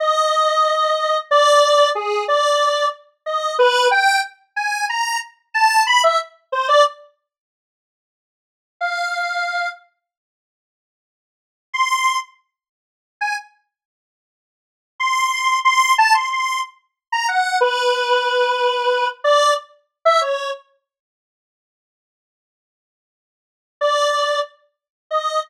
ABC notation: X:1
M:6/8
L:1/16
Q:3/8=61
K:none
V:1 name="Lead 1 (square)"
_e8 d4 | _A2 d4 z2 _e2 B2 | g2 z2 _a2 _b2 z2 =a2 | b e z2 c d z6 |
z6 f6 | z12 | c'3 z6 _a z2 | z8 c'4 |
c'2 a c' c'2 z3 _b _g2 | B10 d2 | z3 e _d2 z6 | z12 |
z2 d4 z4 _e2 |]